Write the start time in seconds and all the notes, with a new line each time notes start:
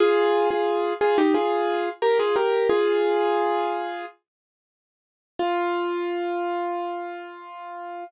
0.00 F4 G#4
0.51 F4 G#4
1.01 F4 G#4
1.18 D#4 G4
1.34 F4 G#4
2.02 G4 A#4
2.19 F4 G#4
2.36 G4 A#4
2.70 F4 G#4
5.39 F4